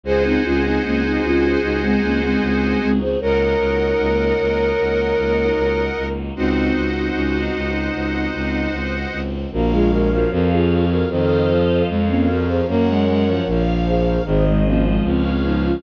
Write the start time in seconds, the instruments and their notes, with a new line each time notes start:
0.03 violin C#2 G#4, string ensemble 1 C4 D#4 F#4 G#4, flute G#4 C5, accordion C5 D#5 F#5 G#5
0.25 flute C4 D#4
0.44 violin C#2, flute C#4 F4
0.64 flute C4 D#4
0.84 violin C#2, flute A#3 C#4
1.03 flute C4 D#4
1.23 violin C#2, flute C#4 F4
1.63 violin C#2, flute D#4 F#4
1.82 flute G#3 C4
2.02 violin C#2, flute A#3 C#4
2.22 flute G#3 C4
2.41 violin C#2, flute G#3 C4
2.81 violin C#2, flute G#3 C4
3.01 flute G#4 C5
3.20 violin C#2 A#4, string ensemble 1 A#3 D#4 F#4, flute A#4 C#5, accordion A#4 D#5 F#5
3.59 violin C#2
3.99 violin C#2
4.39 violin C#2
4.79 violin C#2
5.17 violin C#2
5.56 violin C#2
5.97 violin C#2
6.36 violin C#2 C4, string ensemble 1 C4 D#4 F#4, flute D#4 F#4, accordion C5 D#5 F#5
6.76 violin C#2
7.15 violin C#2 C#4
7.37 violin D#4
7.55 violin C#2
7.94 violin C#2
8.34 violin C#2
8.72 violin C#2
9.12 violin C#2
9.52 violin A#1 A#3, flute F#4 A#4, string ensemble 1 A#4 C#5 F5
9.70 violin G#3, flute F4 G#4
9.90 violin G#3, flute F#4 A#4
10.11 violin F3, flute F#4 A#4
10.31 violin F2 F3, flute F#4 A#4, string ensemble 1 G#4 C#5 F5
10.51 flute F4 G#4
10.90 flute F#4 A#4
11.09 violin F2 D#3, flute A4 C5, string ensemble 1 A4 C5 D#5 F5
11.49 violin F3
11.88 violin F2, flute G#3 C4, string ensemble 1 A#4 C#5 F5
12.09 flute A#3 C#4
12.28 violin F3, flute F#4 A#4
12.48 flute G#4 C5
12.68 violin F#2 A#3, flute A#4 C#5, string ensemble 1 A#4 C#5 F#5
12.88 violin G#3
13.06 violin G#3
13.27 violin F3
13.46 violin A#1 F3, string ensemble 1 A#4 C#5 F5
13.87 flute G#4 C5
14.25 violin G#1 D#3, flute G#4 C5, string ensemble 1 G#4 C5 D#5
14.46 flute G#3 C4
14.65 violin F3, flute A#3 C#4
14.85 flute G#3 C4
15.03 violin C#2, flute C4, string ensemble 1 G#4 B4 C#5 F5
15.25 flute C4
15.43 violin F3, flute B3 D#4
15.64 flute C#4 F4